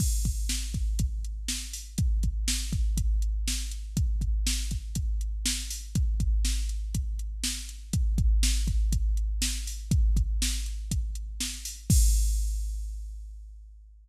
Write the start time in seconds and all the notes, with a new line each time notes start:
0.00 kick, crash
0.25 kick, closed hi-hat
0.49 snare
0.74 kick, closed hi-hat
0.99 kick, closed hi-hat
1.24 closed hi-hat
1.48 snare
1.73 open hi-hat
1.98 kick, closed hi-hat
2.23 kick, closed hi-hat
2.48 snare
2.73 kick, closed hi-hat
2.97 kick, closed hi-hat
3.22 closed hi-hat
3.48 snare
3.71 closed hi-hat
3.97 kick, closed hi-hat
4.21 kick, closed hi-hat
4.47 snare
4.71 kick, closed hi-hat
4.95 kick, closed hi-hat
5.21 closed hi-hat
5.46 snare
5.70 open hi-hat
5.95 kick, closed hi-hat
6.20 kick, closed hi-hat
6.45 snare
6.69 closed hi-hat
6.95 kick, closed hi-hat
7.19 closed hi-hat
7.44 snare
7.69 closed hi-hat
7.93 kick, closed hi-hat
8.18 kick, closed hi-hat
8.43 snare
8.67 kick, closed hi-hat
8.92 kick, closed hi-hat
9.17 closed hi-hat
9.42 snare
9.67 open hi-hat
9.91 kick, closed hi-hat
10.17 kick, closed hi-hat
10.42 snare
10.66 closed hi-hat
10.91 kick, closed hi-hat
11.15 closed hi-hat
11.40 snare
11.65 open hi-hat
11.90 kick, crash